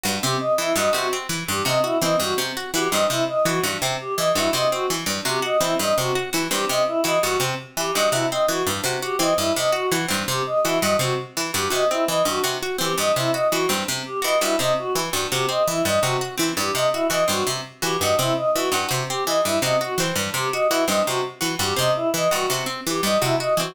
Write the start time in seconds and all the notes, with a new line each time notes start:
0.04 G2 F#4
0.22 C3 C4 G4
0.40 D#5
0.58 E3 E4
0.76 G2 F#4 D#5
0.93 C3 F#4
1.13 C4
1.29 E3
1.48 G2 G4
1.65 C3 F#4 D#5
1.83 E4 F#4
2.02 E3 C4 D#5
2.20 G2 F#4
2.38 C3
2.57 F#4
2.74 E3 F#4 G4
2.91 G2 C4 D#5
3.09 C3 E4
3.28 D#5
3.45 E3 F#4
3.64 G2 F#4
3.82 C3 C4
4.00 G4
4.17 E3 D#5
4.35 G2 E4 F#4
4.53 C3 F#4 D#5
4.72 C4 F#4
4.90 E3
5.06 G2
5.25 C3 F#4 G4
5.42 F#4 D#5
5.61 E3 C4 E4
5.79 G2 D#5
5.98 C3 F#4
6.15 F#4
6.33 E3 F#4
6.51 G2 C4 G4
6.69 C3 D#5
6.87 E4
7.04 E3 F#4 D#5
7.23 G2 F#4
7.40 C3 C4
7.77 E3 G4
7.94 G2 F#4 D#5
8.11 C3 E4 F#4
8.31 C4 D#5
8.48 E3 F#4
8.67 G2
8.84 C3 F#4
9.02 F#4 G4
9.19 E3 C4 D#5
9.38 G2 E4
9.56 C3 D#5
9.72 F#4
9.92 E3 F#4
10.08 G2 C4
10.28 C3 G4
10.46 D#5
10.64 E3 E4 F#4
10.81 G2 F#4 D#5
10.99 C3 C4 F#4
11.37 E3
11.53 G2 F#4 G4
11.70 C3 F#4 D#5
11.90 C4 E4
12.08 E3 D#5
12.25 G2 F#4
12.44 C3 F#4
12.63 F#4
12.78 E3 C4 G4
12.98 G2 D#5
13.16 C3 E4
13.33 F#4 D#5
13.52 E3 F#4
13.69 G2 C4
13.88 C3
14.06 G4
14.22 E3 F#4 D#5
14.41 G2 E4 F#4
14.59 C3 C4 D#5
14.78 F#4
14.96 E3
15.13 G2 F#4
15.32 C3 F#4 G4
15.49 C4 D#5
15.68 E3 E4
15.85 G2 D#5
16.02 C3 F#4
16.21 F#4
16.38 E3 C4
16.57 G2 G4
16.74 C3 D#5
16.92 E4 F#4
17.10 E3 F#4 D#5
17.28 G2 C4 F#4
17.47 C3
17.82 E3 F#4 G4
18.01 G2 F#4 D#5
18.19 C3 C4 E4
18.37 D#5
18.54 E3 F#4
18.72 G2 F#4
18.89 C3 F#4
19.09 C4 G4
19.26 E3 D#5
19.44 G2 E4
19.62 C3 F#4 D#5
19.80 F#4
19.98 E3 C4
20.16 G2
20.34 C3 G4
20.53 F#4 D#5
20.70 E3 E4 F#4
20.87 G2 C4 D#5
21.05 C3 F#4
21.41 E3 F#4
21.59 G2 F#4 G4
21.76 C3 C4 D#5
21.95 E4
22.14 E3 D#5
22.31 G2 F#4
22.50 C3 F#4
22.66 C4
22.87 E3 G4
23.03 G2 D#5
23.21 C3 E4 F#4
23.40 F#4 D#5
23.57 E3 C4 F#4